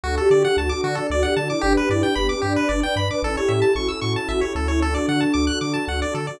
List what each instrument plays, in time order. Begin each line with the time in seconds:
0.04 synth bass 1 D2, pad 2 (warm) D4 F#4 A4, lead 1 (square) F#4, ocarina A4
0.17 ocarina G4, lead 1 (square) A4
0.30 synth bass 1 D3, lead 1 (square) D5
0.45 lead 1 (square) F#5
0.57 synth bass 1 D2, ocarina F#4, lead 1 (square) A5
0.69 ocarina F#4, lead 1 (square) D6
0.84 synth bass 1 D3, pad 2 (warm) D4 A4 D5, lead 1 (square) F#4
0.95 lead 1 (square) A4
1.10 synth bass 1 D2, ocarina F#4, lead 1 (square) D5
1.23 ocarina G4, lead 1 (square) F#5
1.36 synth bass 1 D3, ocarina F#4, lead 1 (square) A5
1.49 ocarina E4, lead 1 (square) D6
1.61 synth bass 1 G1, ocarina D4, pad 2 (warm) D4 G4 B4, lead 1 (square) G4
1.77 lead 1 (square) B4
1.89 synth bass 1 G2, ocarina E4, lead 1 (square) D5
2.03 ocarina D4, lead 1 (square) G5
2.15 synth bass 1 G1, ocarina B3, lead 1 (square) B5
2.29 ocarina C#4, lead 1 (square) D6
2.42 synth bass 1 G2, pad 2 (warm) D4 B4 D5, ocarina D4, lead 1 (square) G4
2.56 lead 1 (square) B4
2.69 synth bass 1 G1, ocarina D4, lead 1 (square) D5
2.83 ocarina D4, lead 1 (square) G5
2.96 synth bass 1 G2, lead 1 (square) B5
3.09 ocarina B4, lead 1 (square) D6
3.22 synth bass 1 A1, pad 2 (warm) C#4 E4 A4, ocarina A4, lead 1 (square) A4
3.36 ocarina G4, lead 1 (square) C#5
3.48 synth bass 1 A2, lead 1 (square) E5
3.62 lead 1 (square) A5
3.75 synth bass 1 A1, ocarina F#4, lead 1 (square) C#6
3.88 ocarina F#4, lead 1 (square) E6
4.02 synth bass 1 A2, lead 1 (square) C#6
4.16 lead 1 (square) A5
4.29 synth bass 1 A1, ocarina F#4, lead 1 (square) E5
4.41 ocarina G4, lead 1 (square) C#5
4.55 synth bass 1 D2, ocarina F#4, lead 1 (square) A4
4.68 ocarina E4, lead 1 (square) C#5
4.82 pad 2 (warm) D4 F#4 A4, ocarina D4, lead 1 (square) A4
4.95 lead 1 (square) D5
5.08 synth bass 1 D3, lead 1 (square) F#5
5.21 lead 1 (square) A5
5.34 synth bass 1 D2, lead 1 (square) D6
5.47 lead 1 (square) F#6
5.61 synth bass 1 D3, lead 1 (square) D6
5.74 lead 1 (square) A5
5.88 synth bass 1 D2, lead 1 (square) F#5
6.02 lead 1 (square) D5
6.14 synth bass 1 D3, lead 1 (square) A4
6.27 lead 1 (square) D5